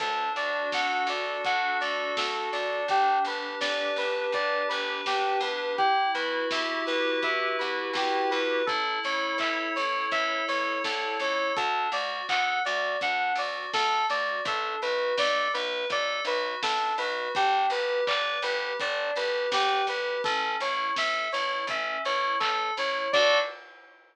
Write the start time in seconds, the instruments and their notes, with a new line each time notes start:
0.00 electric bass (finger) D2, electric piano 2 D4 A4, kick, crash
0.36 electric bass (finger) D2, electric piano 2 F#4 D5, open hi-hat
0.72 electric bass (finger) D2, electric piano 2 A4 F#5, kick, snare
1.07 electric bass (finger) D2, electric piano 2 D4 D5, open hi-hat
1.43 electric bass (finger) D2, electric piano 2 F#4 F#5, kick, closed hi-hat
1.81 electric bass (finger) D2, electric piano 2 A4 D5, open hi-hat
2.17 electric bass (finger) D2, electric piano 2 D4 A4, kick, snare
2.52 electric bass (finger) D2, electric piano 2 D4 D5, open hi-hat
2.88 electric bass (finger) G1, electric piano 2 G4, kick, closed hi-hat
3.25 electric bass (finger) G1, electric piano 2 G4 B4, open hi-hat
3.61 electric bass (finger) G1, electric piano 2 B4 D5, kick, snare
3.96 electric bass (finger) G1, electric piano 2 D4 B4, open hi-hat
4.32 electric bass (finger) G1, electric piano 2 G4 D5, kick, closed hi-hat
4.69 electric bass (finger) G1, electric piano 2 B4, open hi-hat
5.06 electric bass (finger) G1, electric piano 2 D4 G4, kick, snare
5.41 electric bass (finger) E2, electric piano 2 G4 B4, open hi-hat
5.78 electric piano 2 E4 G4, kick, closed hi-hat
6.14 electric bass (finger) E2, electric piano 2 F#4 B4, open hi-hat
6.51 electric bass (finger) E2, electric piano 2 G4 E5, kick, snare
6.86 electric bass (finger) E2, electric piano 2 B4, open hi-hat
7.22 electric bass (finger) E2, electric piano 2 E4 E5, kick, closed hi-hat
7.59 electric bass (finger) E2, electric piano 2 F#4 B4, open hi-hat
7.93 electric bass (finger) E2, electric piano 2 G4, kick, snare
8.30 electric bass (finger) E2, electric piano 2 B4, open hi-hat
8.66 electric bass (finger) A1, electric piano 2 E4 A4, kick, closed hi-hat
9.04 electric bass (finger) A1, electric piano 2 A4 C#5, open hi-hat
9.38 electric bass (finger) A1, electric piano 2 C#5 E5, kick, clap
9.76 electric bass (finger) A1, electric piano 2 E4 C#5, open hi-hat
10.11 electric bass (finger) A1, electric piano 2 A4 E5, kick, closed hi-hat
10.48 electric bass (finger) A1, electric piano 2 C#5, open hi-hat
10.83 electric bass (finger) C2, electric piano 2 E4 A4, kick, snare
11.19 electric bass (finger) C#2, electric piano 2 A4 C#5, open hi-hat
11.56 electric bass (finger) D2, electric piano 2 D4 A4, kick, closed hi-hat
11.92 electric bass (finger) D2, electric piano 2 F#4 D5, open hi-hat
12.28 electric bass (finger) D2, electric piano 2 A4 F#5, kick, clap
12.65 electric bass (finger) D2, electric piano 2 F#4 D5, open hi-hat
13.00 electric bass (finger) D2, electric piano 2 D4 F#5, kick, closed hi-hat
13.35 electric bass (finger) D2, electric piano 2 F#4 D5, open hi-hat
13.73 electric bass (finger) D2, electric piano 2 A4, kick, snare
14.09 electric bass (finger) D2, electric piano 2 F#4 D5, open hi-hat
14.45 electric bass (finger) B1, electric piano 2 D4 A4, kick, closed hi-hat
14.82 electric bass (finger) B1, electric piano 2 F#4 B4, open hi-hat
15.17 electric bass (finger) B1, electric piano 2 A4 D5, kick, snare
15.54 electric bass (finger) B1, electric piano 2 B4, open hi-hat
15.90 electric bass (finger) B1, electric piano 2 A4 D5, kick, closed hi-hat
16.25 electric bass (finger) B1, electric piano 2 F#4 B4, open hi-hat
16.62 electric bass (finger) B1, electric piano 2 D4 A4, kick, snare
16.98 electric bass (finger) B1, electric piano 2 F#4 B4, open hi-hat
17.34 electric bass (finger) G1, electric piano 2 D4 G4, kick, closed hi-hat
17.70 electric bass (finger) G1, electric piano 2 G4 B4, open hi-hat
18.07 electric bass (finger) G1, electric piano 2 B4 D5, kick, clap
18.42 electric bass (finger) G1, electric piano 2 G4 B4, open hi-hat
18.79 electric bass (finger) G1, electric piano 2 D4 D5, kick, closed hi-hat
19.16 electric bass (finger) G1, electric piano 2 G4 B4, open hi-hat
19.52 electric bass (finger) G1, electric piano 2 G4 B4, kick, snare
19.87 electric bass (finger) G1, electric piano 2 G4 B4, open hi-hat
20.24 electric bass (finger) A1, electric piano 2 C#4 A4, kick, closed hi-hat
20.60 electric bass (finger) A1, electric piano 2 E4 C#5, open hi-hat
20.96 electric bass (finger) A1, electric piano 2 A4 E5, kick, snare
21.32 electric bass (finger) A1, electric piano 2 E4 C#5, open hi-hat
21.67 electric bass (finger) A1, electric piano 2 C#4 E5, kick, closed hi-hat
22.05 electric bass (finger) A1, electric piano 2 E4 C#5, open hi-hat
22.40 electric bass (finger) A1, electric piano 2 A4, kick, clap
22.77 electric bass (finger) A1, electric piano 2 E4 C#5, open hi-hat
23.13 electric bass (finger) D2, electric piano 2 D4 F#4 A4 D5, kick, crash